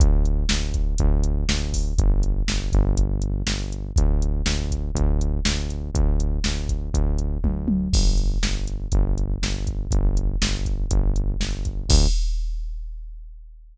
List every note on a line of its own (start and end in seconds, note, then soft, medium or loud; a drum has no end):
0.00 0.45 D2 medium
0.00 kick loud
0.00 closed hi-hat loud
0.25 closed hi-hat medium
0.49 0.95 D2 medium
0.49 snare loud
0.74 kick medium
0.74 closed hi-hat medium
0.98 1.44 D2 medium
0.98 kick medium
0.98 closed hi-hat medium
1.24 closed hi-hat medium
1.49 1.93 D2 medium
1.49 snare loud
1.73 kick medium
1.73 open hi-hat medium
1.98 2.43 G1 medium
1.98 kick medium
1.98 closed hi-hat medium
2.23 closed hi-hat medium
2.48 2.72 G1 medium
2.48 snare medium
2.72 3.42 G1 loud
2.72 kick medium
2.72 closed hi-hat medium
2.97 kick medium
2.97 closed hi-hat medium
3.22 closed hi-hat medium
3.47 3.91 G1 medium
3.47 snare medium
3.72 closed hi-hat medium
3.96 4.42 D2 medium
3.96 kick loud
3.96 closed hi-hat loud
4.22 closed hi-hat medium
4.46 4.90 D2 medium
4.46 snare loud
4.71 kick medium
4.71 closed hi-hat medium
4.95 5.40 D2 medium
4.95 kick medium
4.95 closed hi-hat medium
5.21 closed hi-hat medium
5.45 5.90 D2 medium
5.45 snare loud
5.70 closed hi-hat medium
5.95 6.39 D2 medium
5.95 kick medium
5.95 closed hi-hat medium
6.20 closed hi-hat medium
6.44 6.90 D2 medium
6.44 snare medium
6.69 kick medium
6.69 closed hi-hat medium
6.93 7.38 D2 medium
6.93 kick medium
6.93 closed hi-hat medium
7.18 closed hi-hat medium
7.44 7.88 D2 medium
7.44 kick medium
7.44 high tom medium
7.68 high tom loud
7.93 8.38 G1 medium
7.93 kick loud
7.93 crash medium
8.17 closed hi-hat medium
8.43 8.87 G1 medium
8.43 snare medium
8.67 closed hi-hat medium
8.92 9.38 G1 medium
8.92 kick medium
8.92 closed hi-hat medium
9.18 closed hi-hat medium
9.42 9.87 G1 medium
9.42 snare medium
9.67 kick medium
9.67 closed hi-hat medium
9.91 10.36 G1 medium
9.91 kick medium
9.91 closed hi-hat medium
10.17 closed hi-hat medium
10.42 10.86 G1 medium
10.42 snare loud
10.65 kick medium
10.65 closed hi-hat medium
10.91 11.36 G1 medium
10.91 kick medium
10.91 closed hi-hat loud
11.16 closed hi-hat medium
11.40 11.85 G1 medium
11.40 snare medium
11.65 kick medium
11.65 closed hi-hat medium
11.89 12.07 D2 loud
11.89 kick loud
11.89 crash loud